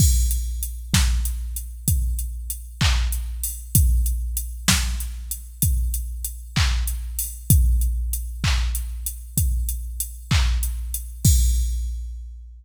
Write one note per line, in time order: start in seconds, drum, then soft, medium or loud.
0.00 kick loud
0.00 crash loud
0.31 closed hi-hat medium
0.63 closed hi-hat medium
0.94 kick medium
0.94 snare loud
1.25 closed hi-hat medium
1.56 closed hi-hat medium
1.88 kick medium
1.88 closed hi-hat loud
2.19 closed hi-hat medium
2.50 closed hi-hat medium
2.81 kick medium
2.81 clap loud
3.12 closed hi-hat medium
3.43 open hi-hat medium
3.75 kick loud
3.75 closed hi-hat loud
4.06 closed hi-hat medium
4.37 closed hi-hat medium
4.68 kick medium
4.68 snare loud
5.00 closed hi-hat medium
5.31 closed hi-hat medium
5.62 kick medium
5.62 closed hi-hat loud
5.94 closed hi-hat medium
6.24 closed hi-hat medium
6.56 kick medium
6.56 clap loud
6.88 closed hi-hat medium
7.19 open hi-hat medium
7.50 kick loud
7.50 closed hi-hat loud
7.81 closed hi-hat medium
8.13 closed hi-hat medium
8.44 kick medium
8.44 clap loud
8.75 closed hi-hat medium
9.06 closed hi-hat medium
9.37 kick medium
9.37 closed hi-hat loud
9.69 closed hi-hat medium
10.00 closed hi-hat medium
10.31 kick medium
10.31 clap loud
10.63 closed hi-hat medium
10.94 closed hi-hat medium
11.25 kick loud
11.25 crash loud